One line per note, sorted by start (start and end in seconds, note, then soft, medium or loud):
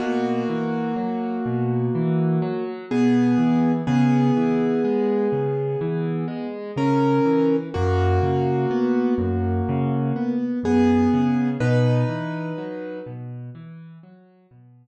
0.00 0.43 B2 loud
0.00 2.64 A#3 medium
0.00 2.64 F#4 medium
0.49 0.93 E3 medium
0.96 1.40 F#3 medium
1.46 1.89 B2 medium
1.95 2.39 E3 medium
2.42 2.85 F#3 loud
2.91 3.35 B2 loud
2.91 3.72 B3 medium
2.91 3.72 G#4 medium
3.38 3.82 E3 medium
3.87 4.31 C#3 loud
3.87 6.47 B3 medium
3.87 6.47 G#4 medium
4.37 4.80 E3 medium
4.84 5.28 G#3 medium
5.32 5.76 C#3 medium
5.81 6.25 E3 loud
6.28 6.71 G#3 medium
6.76 7.20 C#3 medium
6.76 7.56 C#4 medium
6.76 7.56 A#4 medium
7.25 7.69 E3 medium
7.74 8.19 F#2 loud
7.74 10.35 A#3 medium
7.74 10.35 F#4 medium
8.23 8.66 C#3 medium
8.71 9.14 B3 medium
9.18 9.61 F#2 medium
9.69 10.12 C#3 loud
10.16 10.59 B3 medium
10.63 11.07 F#2 medium
10.63 11.49 B3 medium
10.63 11.49 G#4 medium
11.14 11.57 C#3 medium
11.60 12.04 B2 loud
11.60 12.99 D#4 medium
11.60 12.99 B4 medium
12.08 12.52 E3 medium
12.58 13.01 F#3 medium
13.06 13.50 B2 medium
13.55 13.98 E3 loud
14.03 14.47 F#3 medium
14.51 14.87 B2 medium